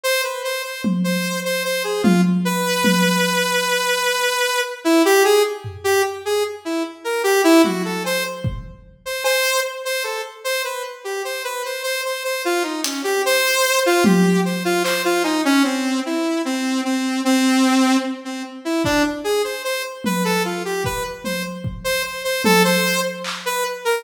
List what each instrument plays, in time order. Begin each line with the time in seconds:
0.04 lead 2 (sawtooth) C5
0.24 lead 2 (sawtooth) B4
0.44 lead 2 (sawtooth) C5
0.64 lead 2 (sawtooth) C5
0.84 high tom
1.04 lead 2 (sawtooth) C5
1.45 lead 2 (sawtooth) C5
1.65 lead 2 (sawtooth) C5
1.84 lead 2 (sawtooth) G#4
2.03 lead 2 (sawtooth) F4, high tom
2.45 lead 2 (sawtooth) B4
2.84 high tom
4.84 lead 2 (sawtooth) E4
5.05 lead 2 (sawtooth) G4
5.24 lead 2 (sawtooth) G#4
5.64 floor tom
5.84 lead 2 (sawtooth) G4
6.25 lead 2 (sawtooth) G#4
6.65 lead 2 (sawtooth) E4
7.04 lead 2 (sawtooth) A#4
7.24 lead 2 (sawtooth) G4
7.44 lead 2 (sawtooth) E4
7.64 lead 2 (sawtooth) F#4, high tom
7.85 lead 2 (sawtooth) A4
8.04 lead 2 (sawtooth) C5, cowbell
8.44 kick
9.05 lead 2 (sawtooth) C5
9.24 lead 2 (sawtooth) C5, cowbell
9.85 lead 2 (sawtooth) C5
10.04 lead 2 (sawtooth) A4
10.44 lead 2 (sawtooth) C5
10.64 lead 2 (sawtooth) B4
11.04 lead 2 (sawtooth) G4
11.25 lead 2 (sawtooth) C5
11.44 lead 2 (sawtooth) B4
11.65 lead 2 (sawtooth) C5
11.83 lead 2 (sawtooth) C5
12.05 lead 2 (sawtooth) C5
12.24 lead 2 (sawtooth) C5
12.45 lead 2 (sawtooth) F4
12.63 lead 2 (sawtooth) D#4
12.84 lead 2 (sawtooth) C#4, closed hi-hat
13.04 lead 2 (sawtooth) G4
13.26 lead 2 (sawtooth) C5
13.86 lead 2 (sawtooth) F4
14.04 lead 2 (sawtooth) G4, high tom
14.45 lead 2 (sawtooth) C5
14.65 lead 2 (sawtooth) F4
14.84 lead 2 (sawtooth) C5, clap
15.05 lead 2 (sawtooth) F4
15.23 lead 2 (sawtooth) D#4, cowbell
15.45 lead 2 (sawtooth) C#4
15.64 lead 2 (sawtooth) C4
16.06 lead 2 (sawtooth) E4
16.45 lead 2 (sawtooth) C4
16.85 lead 2 (sawtooth) C4
17.25 lead 2 (sawtooth) C4
18.25 lead 2 (sawtooth) C4
18.65 lead 2 (sawtooth) E4
18.84 lead 2 (sawtooth) D4, kick
19.24 lead 2 (sawtooth) G#4
19.44 lead 2 (sawtooth) C5
19.64 lead 2 (sawtooth) C5
20.04 lead 2 (sawtooth) B4, high tom
20.25 lead 2 (sawtooth) A4
20.45 lead 2 (sawtooth) F4
20.65 lead 2 (sawtooth) G4
20.84 lead 2 (sawtooth) B4, kick
21.24 lead 2 (sawtooth) C5, high tom
21.64 kick
21.84 lead 2 (sawtooth) C5
22.04 lead 2 (sawtooth) C5
22.24 lead 2 (sawtooth) C5
22.44 lead 2 (sawtooth) A4, high tom
22.64 lead 2 (sawtooth) C5
23.24 clap
23.46 lead 2 (sawtooth) B4
23.85 lead 2 (sawtooth) A#4